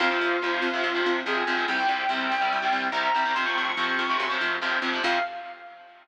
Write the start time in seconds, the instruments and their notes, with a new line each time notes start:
0.00 electric bass (finger) F2, overdriven guitar C3 F3, distortion guitar F4
0.10 overdriven guitar C3 F3
0.21 electric bass (finger) F2
0.42 electric bass (finger) F2, overdriven guitar C3 F3
0.62 electric bass (finger) F2
0.73 overdriven guitar C3 F3
0.83 electric bass (finger) F2
0.95 overdriven guitar C3 F3
1.06 electric bass (finger) F2
1.26 electric bass (finger) F2, overdriven guitar C3 F3, distortion guitar G#4
1.47 electric bass (finger) F2, overdriven guitar C3 F3
1.57 overdriven guitar C3 F3
1.68 electric bass (finger) C2, overdriven guitar C3 G3, distortion guitar G5
1.78 overdriven guitar C3 G3
1.89 electric bass (finger) C2
2.09 electric bass (finger) C2, overdriven guitar C3 G3
2.31 electric bass (finger) C2
2.41 overdriven guitar C3 G3
2.52 electric bass (finger) C2
2.62 overdriven guitar C3 G3
2.72 electric bass (finger) C2
2.92 electric bass (finger) C2, overdriven guitar C3 G3, distortion guitar A#5
3.14 electric bass (finger) C2, overdriven guitar C3 G3
3.25 overdriven guitar C3 G3
3.35 electric bass (finger) F2, overdriven guitar C3 F3, distortion guitar C6
3.45 overdriven guitar C3 F3, distortion guitar C#6
3.56 electric bass (finger) F2, distortion guitar C#6
3.66 distortion guitar C#6
3.77 electric bass (finger) F2, overdriven guitar C3 F3
3.99 electric bass (finger) F2
4.09 overdriven guitar C3 F3
4.20 electric bass (finger) F#2
4.30 overdriven guitar C3 F3
4.41 electric bass (finger) F2
4.62 electric bass (finger) F2, overdriven guitar C3 F3
4.82 electric bass (finger) F2, overdriven guitar C3 F3
4.93 overdriven guitar C3 F3
5.03 electric bass (finger) F2, overdriven guitar C3 F3, distortion guitar F5